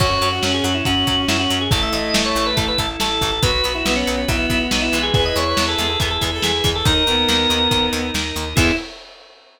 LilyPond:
<<
  \new Staff \with { instrumentName = "Drawbar Organ" } { \time 4/4 \key e \major \tempo 4 = 140 cis''8. fis'8 gis'16 fis'16 e'16 fis'4 e'16 fis'8 gis'16 | a'16 e''16 dis''8. cis''8 b'16 a'16 b'16 a'16 r16 a'8. a'16 | b'8. e'8 cis'16 cis'16 cis'16 e'4 dis'16 e'8 gis'16 | gis'16 dis''16 cis''8. a'8 a'16 gis'16 a'16 gis'16 r16 gis'8. a'16 |
ais'2~ ais'8 r4. | e'4 r2. | }
  \new Staff \with { instrumentName = "Violin" } { \time 4/4 \key e \major fis'8 fis'8 cis'4 cis'2 | a2~ a8 r4. | fis'8 fis'8 b4 b2 | b'8. b'8. gis'8 a'16 r8 a'16 r8. a'16 |
dis'8 b2~ b8 r4 | e'4 r2. | }
  \new Staff \with { instrumentName = "Acoustic Guitar (steel)" } { \time 4/4 \key e \major <fis cis'>8 <fis cis'>8 <fis cis'>8 <fis cis'>8 <fis cis'>8 <fis cis'>8 <fis cis'>8 <fis cis'>8 | <e a>8 <e a>8 <e a>8 <e a>8 <e a>8 <e a>8 <e a>8 <e a>8 | <fis b>8 <fis b>8 <fis b>8 <fis b>8 <fis b>8 <fis b>8 <fis b>8 <e gis b>8~ | <e gis b>8 <e gis b>8 <e gis b>8 <e gis b>8 <e gis b>8 <e gis b>8 <e gis b>8 <e gis b>8 |
<dis ais>8 <dis ais>8 <dis ais>8 <dis ais>8 <dis ais>8 <dis ais>8 <dis ais>8 <dis ais>8 | <e gis b>4 r2. | }
  \new Staff \with { instrumentName = "Drawbar Organ" } { \time 4/4 \key e \major <cis' fis'>2 <cis' fis'>2 | <e' a'>2 <e' a'>2 | <fis' b'>2 <fis' b'>2 | <e' gis' b'>2 <e' gis' b'>2 |
<dis' ais'>2 <dis' ais'>2 | <b e' gis'>4 r2. | }
  \new Staff \with { instrumentName = "Electric Bass (finger)" } { \clef bass \time 4/4 \key e \major fis,8 fis,8 fis,8 fis,8 fis,8 fis,8 fis,8 fis,8 | a,,8 a,,8 a,,8 a,,8 a,,8 a,,8 a,,8 a,,8 | b,,8 b,,8 b,,8 b,,8 b,,8 b,,8 b,,8 b,,8 | e,8 e,8 e,8 e,8 e,8 e,8 e,8 e,8 |
dis,8 dis,8 dis,8 dis,8 dis,8 dis,8 dis,8 dis,8 | e,4 r2. | }
  \new Staff \with { instrumentName = "Drawbar Organ" } { \time 4/4 \key e \major <cis' fis'>1 | <e' a'>1 | <fis' b'>1 | <e' gis' b'>1 |
<dis' ais'>1 | <b e' gis'>4 r2. | }
  \new DrumStaff \with { instrumentName = "Drums" } \drummode { \time 4/4 <cymc bd>8 hh8 sn8 hh8 <hh bd>8 <hh bd>8 sn8 hh8 | <hh bd>8 hh8 sn8 hh8 <hh bd>8 <hh bd>8 sn8 <hh bd>8 | <hh bd>8 hh8 sn8 hh8 <hh bd>8 <hh bd>8 sn8 hh8 | <hh bd>8 hh8 sn8 hh8 <hh bd>8 <hh bd>8 sn8 <hh bd>8 |
<hh bd>8 hh8 sn8 hh8 <hh bd>8 hh8 sn8 hh8 | <cymc bd>4 r4 r4 r4 | }
>>